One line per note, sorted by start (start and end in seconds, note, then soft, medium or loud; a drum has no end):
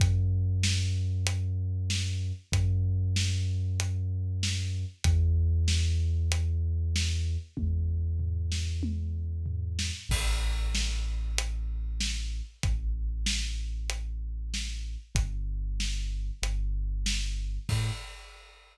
0.00 2.32 F#2 loud
0.00 kick loud
0.00 closed hi-hat loud
0.63 snare loud
1.27 closed hi-hat loud
1.90 snare loud
2.52 4.85 F#2 loud
2.52 kick loud
2.52 closed hi-hat loud
3.16 snare loud
3.80 closed hi-hat loud
4.43 snare loud
5.04 7.37 E2 loud
5.04 kick loud
5.04 closed hi-hat loud
5.68 snare loud
6.32 closed hi-hat loud
6.96 snare loud
7.57 9.91 E2 medium
7.57 kick loud
7.57 high tom medium
8.19 floor tom medium
8.52 snare loud
8.83 high tom loud
9.46 floor tom loud
9.79 snare loud
10.09 12.42 A1 loud
10.09 kick loud
10.09 crash loud
10.75 snare loud
11.38 closed hi-hat loud
12.01 snare loud
12.63 14.97 A1 medium
12.63 kick loud
12.63 closed hi-hat loud
13.26 snare loud
13.90 closed hi-hat loud
14.54 snare loud
15.15 16.31 G1 loud
15.15 kick loud
15.15 closed hi-hat loud
15.80 snare loud
16.42 17.59 G1 loud
16.42 closed hi-hat loud
17.06 snare loud
17.69 17.91 A2 loud
17.69 kick loud
17.69 crash loud